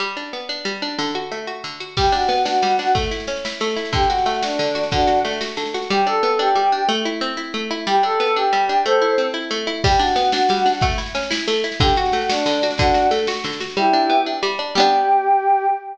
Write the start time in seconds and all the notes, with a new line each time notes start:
0.00 G3
0.17 D4
0.33 B3
0.49 D4
0.65 G3
0.82 D4
0.99 D3
1.15 F#4
1.32 A3
1.47 F#4
1.64 D3
1.80 F#4
1.97 G3 G4, kick, snare, crash
2.05 snare
2.12 D4 F#4, snare
2.21 snare
2.29 B3, snare
2.37 snare
2.45 D4 F#4, snare
2.54 snare
2.62 G3, snare
2.70 snare
2.79 D4, snare
2.87 snare
2.95 A3, kick, snare
3.03 snare
3.11 E4, snare
3.20 snare
3.27 C#4, snare
3.36 snare
3.45 E4, snare
3.53 snare
3.60 A3, snare
3.69 snare
3.76 E4, snare
3.85 snare
3.93 D3 G4, kick, snare
4.03 snare
4.10 F#4, snare
4.18 snare
4.26 A3, snare
4.34 snare
4.42 D4 F#4, snare
4.51 snare
4.59 D3, snare
4.67 snare
4.75 F#4, snare
4.83 snare
4.91 D3 D4 F#4, kick, snare
5.00 snare
5.07 F#4, snare
5.17 snare
5.25 A3, snare
5.33 snare
5.41 F#4, snare
5.49 snare
5.57 D3, snare
5.66 snare
5.74 F#4, snare
5.82 snare
5.90 G3 G4
6.06 D4 A4
6.23 B3
6.39 D4 G4
6.55 G3
6.72 D4
6.89 A3
7.05 E4
7.21 C4
7.37 E4
7.54 A3
7.71 E4
7.87 G3 G4
8.03 D4 A4
8.20 B3
8.36 D4 G4
8.53 G3
8.69 D4
8.85 A3 A4 C5
9.02 E4
9.18 C4
9.34 E4
9.51 A3
9.67 E4
9.84 G3 G4, kick, snare, crash
9.91 snare
9.99 D4 F#4, snare
10.07 snare
10.16 B3, snare
10.24 snare
10.32 D4 F#4, snare
10.42 snare
10.49 G3, snare
10.57 snare
10.66 D4, snare
10.73 snare
10.81 A3, kick, snare
10.90 snare
10.98 E4, snare
11.06 snare
11.15 C#4, snare
11.23 snare
11.31 E4, snare
11.39 snare
11.48 A3, snare
11.56 snare
11.64 E4, snare
11.72 snare
11.80 D3 G4, kick, snare
11.88 snare
11.96 F#4, snare
12.05 snare
12.12 A3, snare
12.21 snare
12.29 D4 F#4, snare
12.39 snare
12.46 D3, snare
12.53 snare
12.62 F#4, snare
12.71 snare
12.78 D3 D4 F#4, kick, snare
12.87 snare
12.94 F#4, snare
13.02 snare
13.11 A3, snare
13.19 snare
13.27 F#4, snare
13.35 snare
13.44 D3, snare
13.53 snare
13.60 F#4, snare
13.70 snare
13.77 G3 E4 G4
13.93 D4
14.10 B3
14.26 D4
14.43 G3
14.59 D4
14.75 G3 B3 G4
14.80 D4